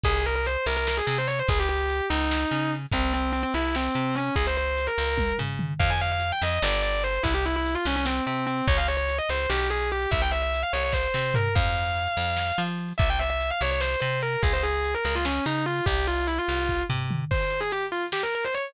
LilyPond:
<<
  \new Staff \with { instrumentName = "Distortion Guitar" } { \time 7/8 \key f \minor \tempo 4 = 146 aes'8 bes'16 bes'16 c''8 bes'16 bes'16 bes'16 aes'16 aes'16 c''16 des''16 c''16 | aes'16 g'16 g'4 ees'4. r8 | c'8 c'8 c'16 c'16 e'8 c'4 des'8 | aes'16 c''16 c''8. bes'4~ bes'16 r4 |
f''16 aes''16 f''16 f''8 g''16 ees''16 ees''16 d''8 d''8 c''8 | e'16 g'16 e'16 e'8 f'16 des'16 des'16 c'8 c'8 c'8 | des''16 f''16 des''16 des''8 ees''16 c''16 c''16 g'8 aes'8 g'8 | e''16 g''16 e''16 e''8 f''16 des''16 des''16 c''8 c''8 bes'8 |
f''2. r8 | e''16 g''16 e''16 e''8 f''16 des''16 des''16 c''8 c''8 bes'8 | aes'16 c''16 aes'16 aes'8 bes'16 bes'16 f'16 des'8 ees'8 f'8 | g'8 f'8 e'16 f'4~ f'16 r4 |
c''8. aes'16 g'16 r16 f'16 r16 g'16 bes'16 bes'16 c''16 des''16 r16 | }
  \new Staff \with { instrumentName = "Electric Bass (finger)" } { \clef bass \time 7/8 \key f \minor c,4. c,4 c4 | des,4. des,4 des4 | c,4. c,4 c4 | des,4. des,4 des4 |
f,4. f,8 g,,4. | c,4. c,4 c4 | des,4. des,8 b,,4. | c,4. c,4 c4 |
f,4. f,4 f4 | c,4. c,4 c4 | des,4. des,4 des4 | c,4. c,4 c4 |
r2. r8 | }
  \new DrumStaff \with { instrumentName = "Drums" } \drummode { \time 7/8 <hh bd>8 hh8 hh8 hh8 sn8 hh8 hh8 | <hh bd>8 hh8 hh8 hh8 sn8 hh8 hh8 | <hh bd>8 hh8 hh8 hh8 sn8 hh8 hh8 | <hh bd>8 hh8 hh8 hh8 <bd tommh>8 tomfh8 toml8 |
<cymc bd>16 hh16 hh16 hh16 hh16 hh16 hh16 hh16 sn16 hh16 hh16 hh16 hh16 hh16 | <hh bd>16 hh16 hh16 hh16 hh16 hh16 hh16 hh16 sn16 hh16 hh16 hh16 hh16 hh16 | <hh bd>16 hh16 hh16 hh16 hh16 hh16 hh16 hh16 sn16 hh16 hh16 hh16 hh16 hh16 | <hh bd>16 hh16 hh16 hh16 hh16 hh16 hh16 hh16 <bd sn>8 sn8 tomfh8 |
<cymc bd>16 hh16 hh16 hh16 hh16 hh16 hh16 hh16 sn16 hh16 hh16 hh16 hh16 hh16 | <hh bd>16 hh16 hh16 hh16 hh16 hh16 hh16 hh16 sn16 hh16 hh16 hh16 hh16 hh16 | <hh bd>16 hh16 hh16 hh16 hh16 hh16 hh16 hh16 sn16 hh16 hh16 hh16 hh16 hh16 | <hh bd>16 hh16 hh16 hh16 hh16 hh16 hh16 hh16 bd8 tomfh8 toml8 |
<cymc bd>16 hh16 hh16 hh16 hh16 hh16 hh16 hh16 sn16 hh16 hh16 hh16 hh16 hh16 | }
>>